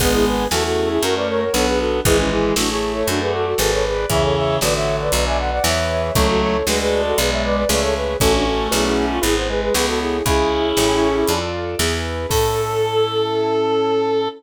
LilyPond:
<<
  \new Staff \with { instrumentName = "Flute" } { \time 4/4 \key a \major \tempo 4 = 117 <gis' b'>16 <e' gis'>16 <gis' b'>8 <fis' a'>16 <fis' a'>8 <e' gis'>16 <fis' ais'>16 <b' d''>16 <ais' cis''>16 <ais' cis''>16 <a' cis''>16 <gis' b'>16 <fis' a'>8 | <e' gis'>16 <cis' e'>16 <e' gis'>8 <d' fis'>16 <e' gis'>8 <a' cis''>16 <d' fis'>16 <gis' b'>16 <fis' a'>16 <fis' a'>16 <fis' a'>16 <a' cis''>16 <gis' b'>8 | <cis'' e''>16 <a' cis''>16 <cis'' e''>8 <b' d''>16 <cis'' e''>8 <b' d''>16 <b' d''>16 <e'' gis''>16 <d'' fis''>16 <d'' fis''>16 <cis'' e''>4 | <a' cis''>16 <fis' a'>16 <a' cis''>8 <gis' b'>16 <gis' b'>8 <fis' a'>16 <gis' b'>16 <cis'' e''>16 <b' d''>16 <b' d''>16 <b' d''>16 <a' cis''>16 <gis' b'>8 |
<fis' a'>16 <d' fis'>16 <fis' a'>8 <e' gis'>16 <e' gis'>8 f'16 <e' gis'>16 c''16 <gis' b'>16 <gis' b'>16 <gis' b'>16 <fis' a'>16 <e' gis'>8 | <e' gis'>2~ <e' gis'>8 r4. | a'1 | }
  \new Staff \with { instrumentName = "Clarinet" } { \time 4/4 \key a \major <gis b>4 a2 b4 | <e gis>4 a2 r4 | <cis e>4 d2 e4 | <fis a>4 gis2 a4 |
<a cis'>2 b8 gis8 b16 b8. | <cis' e'>2~ <cis' e'>8 r4. | a'1 | }
  \new Staff \with { instrumentName = "Acoustic Grand Piano" } { \time 4/4 \key a \major <b d' gis'>4 <cis' e' gis'>4 <cis' fis' ais'>4 <d' fis' b'>4 | <e' gis' b'>4 <e' a' cis''>4 <fis' a' d''>4 <gis' b' d''>4 | <gis' cis'' e''>4 <fis' a' cis''>4 <fis' b' d''>4 <e' gis' b'>4 | <e' a' cis''>4 <fis' a' d''>4 <gis' b' d''>4 <gis' cis'' e''>4 |
<fis' a' cis''>4 <fis' b' d''>4 <e' gis' b'>4 <e' a' cis''>4 | <e' gis' cis''>4 <e' g' a' cis''>4 <f' a' d''>4 <e' gis' b'>4 | <cis' e' a'>1 | }
  \new Staff \with { instrumentName = "Electric Bass (finger)" } { \clef bass \time 4/4 \key a \major gis,,4 e,4 fis,4 b,,4 | gis,,4 a,,4 fis,4 gis,,4 | e,4 a,,4 b,,4 e,4 | cis,4 d,4 b,,4 cis,4 |
a,,4 b,,4 gis,,4 cis,4 | cis,4 a,,4 f,4 e,4 | a,1 | }
  \new DrumStaff \with { instrumentName = "Drums" } \drummode { \time 4/4 <cymc bd>4 sn4 hh4 sn4 | <hh bd>4 sn4 hh4 sn4 | <hh bd>4 sn4 hh4 sn4 | <hh bd>4 sn4 hh4 sn4 |
<hh bd>4 sn4 hh4 sn4 | <hh bd>4 sn4 hh4 sn4 | <cymc bd>4 r4 r4 r4 | }
>>